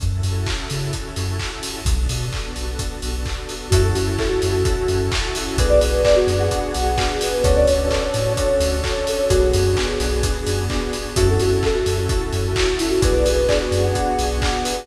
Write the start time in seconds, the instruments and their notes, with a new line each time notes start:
0.00 synth bass 2 F#2, pad 2 (warm) C#4 E4 F#4 A4, kick, closed hi-hat
0.23 synth bass 2 F#2, open hi-hat
0.47 kick, clap
0.70 synth bass 2 C#3, open hi-hat
0.93 kick, closed hi-hat
1.16 synth bass 2 F#2, open hi-hat
1.39 kick, clap
1.63 open hi-hat
1.85 synth bass 2 B1, pad 2 (warm) B3 D4 F#4 A4, kick, closed hi-hat
2.09 synth bass 2 B2, open hi-hat
2.32 kick, clap
2.56 synth bass 2 B1, open hi-hat
2.79 kick, closed hi-hat
3.02 synth bass 2 B1, open hi-hat
3.25 kick, clap
3.49 open hi-hat
3.70 synth bass 2 F#2, pad 2 (warm) C#4 E4 F#4 A4, electric piano 2 C#4 E4 F#4 A4, ocarina F#4, kick, closed hi-hat
3.84 ocarina A4
3.94 synth bass 2 F#2, ocarina F#4, open hi-hat
4.18 electric piano 2 C#4 E4 F#4 A4, ocarina A4, kick, clap
4.28 ocarina F#4
4.42 synth bass 2 F#2, open hi-hat
4.51 ocarina F#4
4.65 electric piano 2 C#4 E4 F#4 A4, kick, closed hi-hat
4.88 synth bass 2 F#2, open hi-hat
5.11 electric piano 2 C#4 E4 F#4 A4, kick, clap
5.35 ocarina E4, open hi-hat
5.46 ocarina F#4
5.57 synth bass 2 B1, pad 2 (warm) B3 D4 F#4 G#4, electric piano 2 B3 D4 F#4 G#4, ocarina B4, kick, closed hi-hat
5.69 ocarina D5
5.80 synth bass 2 B1, ocarina B4, open hi-hat
6.05 electric piano 2 B3 D4 F#4 G#4, ocarina D5, kick, clap
6.16 ocarina F#4
6.27 synth bass 2 F#2, open hi-hat
6.39 ocarina F#5
6.51 electric piano 2 B3 D4 F#4 G#4, kick, closed hi-hat
6.74 synth bass 2 B1, open hi-hat
6.98 electric piano 2 B3 D4 F#4 G#4, kick, clap
7.21 ocarina B4, open hi-hat
7.33 ocarina B4
7.43 synth bass 2 D2, pad 2 (warm) C#4 D4 F#4 A4, electric piano 2 C#4 D4 F#4 A4, ocarina C#5, kick, closed hi-hat
7.56 ocarina D5
7.66 synth bass 2 D2, ocarina C#5, open hi-hat
7.90 electric piano 2 C#4 D4 F#4 A4, ocarina D5, kick, clap
8.02 ocarina C#5
8.14 synth bass 2 A2, open hi-hat
8.26 ocarina C#5
8.37 electric piano 2 C#4 D4 F#4 A4, kick, closed hi-hat
8.60 synth bass 2 D2, open hi-hat
8.84 electric piano 2 C#4 D4 F#4 A4, kick, clap
9.07 ocarina A4, open hi-hat
9.18 ocarina C#5
9.29 synth bass 2 B1, electric piano 2 B3 D4 F#4 G#4, pad 2 (warm) B3 D4 F#4 G#4, ocarina F#4, kick, closed hi-hat
9.53 synth bass 2 F#2, open hi-hat
9.77 electric piano 2 B3 D4 F#4 G#4, kick, clap
10.00 synth bass 2 B1, open hi-hat
10.23 electric piano 2 B3 D4 F#4 G#4, kick, closed hi-hat
10.47 synth bass 2 F#2, open hi-hat
10.70 electric piano 2 B3 D4 F#4 G#4, kick, clap
10.93 open hi-hat
11.16 synth bass 2 F#2, pad 2 (warm) C#4 E4 F#4 A4, electric piano 2 C#4 E4 F#4 A4, ocarina F#4, kick, closed hi-hat
11.30 ocarina A4
11.39 synth bass 2 F#2, ocarina F#4, open hi-hat
11.63 electric piano 2 C#4 E4 F#4 A4, ocarina A4, kick, clap
11.74 ocarina F#4
11.86 synth bass 2 F#2, open hi-hat
11.98 ocarina F#4
12.09 electric piano 2 C#4 E4 F#4 A4, kick, closed hi-hat
12.33 synth bass 2 F#2, open hi-hat
12.56 electric piano 2 C#4 E4 F#4 A4, kick, clap
12.79 ocarina E4, open hi-hat
12.90 ocarina F#4
13.02 synth bass 2 B1, electric piano 2 B3 D4 F#4 G#4, pad 2 (warm) B3 D4 F#4 G#4, ocarina B4, kick, closed hi-hat
13.13 ocarina D5
13.25 synth bass 2 B1, ocarina B4, open hi-hat
13.48 electric piano 2 B3 D4 F#4 G#4, ocarina D5, kick, clap
13.61 ocarina F#4
13.71 synth bass 2 F#2, open hi-hat
13.82 ocarina F#5
13.95 electric piano 2 B3 D4 F#4 G#4, kick, closed hi-hat
14.19 synth bass 2 B1, open hi-hat
14.42 electric piano 2 B3 D4 F#4 G#4, kick, clap
14.64 ocarina B4, open hi-hat
14.76 ocarina B4